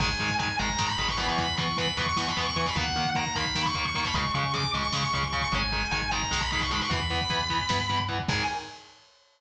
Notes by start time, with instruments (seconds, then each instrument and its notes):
0.00 synth bass 1 G#1, overdriven guitar D#3 G#3, distortion guitar G#5, kick, crash
0.08 kick
0.19 synth bass 1 G#2, overdriven guitar D#3 G#3, kick, closed hi-hat
0.30 kick
0.39 overdriven guitar D#3 G#3, distortion guitar G#5, kick, closed hi-hat
0.48 kick
0.59 synth bass 1 G#1, overdriven guitar D#3 G#3, distortion guitar A#5, kick, closed hi-hat
0.69 kick
0.78 synth bass 1 G#2, overdriven guitar D#3 G#3, kick, snare
0.89 distortion guitar B5, kick
0.98 synth bass 1 G#1, overdriven guitar D#3 G#3, distortion guitar B5, kick, closed hi-hat
1.08 distortion guitar C#6, kick
1.17 overdriven guitar E3 B3, distortion guitar B5, kick, closed hi-hat
1.28 distortion guitar C#6, kick
1.38 synth bass 1 E2, distortion guitar B5, kick, closed hi-hat
1.48 kick
1.57 overdriven guitar E3 B3, synth bass 1 E3, distortion guitar C#6, kick, closed hi-hat
1.68 kick
1.77 overdriven guitar E3 B3, distortion guitar B5, kick, closed hi-hat
1.87 kick
1.97 synth bass 1 E2, overdriven guitar E3 B3, distortion guitar C#6, kick, closed hi-hat
2.06 distortion guitar C#6, kick
2.16 synth bass 1 E3, overdriven guitar E3 B3, distortion guitar C#6, kick, snare
2.27 distortion guitar B5, kick
2.37 synth bass 1 E2, overdriven guitar E3 B3, distortion guitar C#6, kick, closed hi-hat
2.46 distortion guitar C#6, kick
2.56 overdriven guitar E3 B3, distortion guitar C#6, kick, closed hi-hat
2.66 distortion guitar B5, kick
2.75 synth bass 1 D#2, overdriven guitar D#3 A#3, distortion guitar F#5, kick, closed hi-hat
2.88 kick
2.95 synth bass 1 D#3, overdriven guitar D#3 A#3, kick, closed hi-hat
3.05 kick
3.15 overdriven guitar D#3 A#3, distortion guitar A#5, kick, closed hi-hat
3.26 kick
3.35 synth bass 1 D#2, overdriven guitar D#3 A#3, distortion guitar B5, kick, closed hi-hat
3.46 kick
3.55 synth bass 1 D#3, overdriven guitar D#3 A#3, kick, snare
3.66 distortion guitar C#6, kick
3.74 synth bass 1 D#2, overdriven guitar D#3 A#3, distortion guitar C#6, kick, closed hi-hat
3.85 distortion guitar C#6, kick
3.95 overdriven guitar D#3 A#3, distortion guitar C#6, kick, closed hi-hat
4.04 distortion guitar B5, kick
4.14 synth bass 1 C#2, overdriven guitar C#3 G#3, distortion guitar C#6, kick, closed hi-hat
4.25 kick
4.34 synth bass 1 C#3, overdriven guitar C#3 G#3, distortion guitar C#6, kick, closed hi-hat
4.44 kick
4.54 overdriven guitar C#3 G#3, distortion guitar D6, kick, closed hi-hat
4.64 kick
4.73 synth bass 1 C#2, overdriven guitar C#3 G#3, distortion guitar C#6, kick, closed hi-hat
4.83 distortion guitar C#6, kick
4.92 synth bass 1 C#3, overdriven guitar C#3 G#3, distortion guitar C#6, kick, snare
5.03 distortion guitar C#6, kick
5.13 synth bass 1 C#2, overdriven guitar C#3 G#3, distortion guitar C#6, kick, closed hi-hat
5.23 distortion guitar C#6, kick
5.32 overdriven guitar C#3 G#3, distortion guitar C#6, kick, closed hi-hat
5.42 distortion guitar C#6, kick
5.52 synth bass 1 G#1, overdriven guitar D#3 G#3, distortion guitar G#5, kick, closed hi-hat
5.62 kick
5.72 overdriven guitar D#3 G#3, kick, closed hi-hat
5.82 kick
5.91 synth bass 1 G#1, overdriven guitar D#3 G#3, distortion guitar G#5, kick, closed hi-hat
6.02 kick
6.11 overdriven guitar D#3 G#3, distortion guitar A#5, kick, closed hi-hat
6.22 kick
6.31 synth bass 1 B1, overdriven guitar D#3 G#3, kick, snare
6.41 distortion guitar B5, kick
6.51 overdriven guitar D#3 G#3, distortion guitar B5, kick, closed hi-hat
6.60 distortion guitar C#6, kick
6.71 overdriven guitar D#3 G#3, distortion guitar B5, kick, closed hi-hat
6.81 distortion guitar C#6, kick
6.90 synth bass 1 E2, overdriven guitar E3 B3, distortion guitar B5, kick, closed hi-hat
7.00 kick
7.09 overdriven guitar E3 B3, kick, closed hi-hat
7.21 kick
7.29 synth bass 1 E2, overdriven guitar E3 B3, kick, closed hi-hat
7.41 kick
7.50 overdriven guitar E3 B3, kick, closed hi-hat
7.60 kick
7.69 synth bass 1 G2, overdriven guitar E3 B3, kick, snare
7.80 kick
7.89 overdriven guitar E3 B3, kick, closed hi-hat
8.00 kick
8.08 overdriven guitar E3 B3, kick, closed hi-hat
8.20 kick
8.28 synth bass 1 G#2, overdriven guitar D#3 G#3, distortion guitar G#5, kick, crash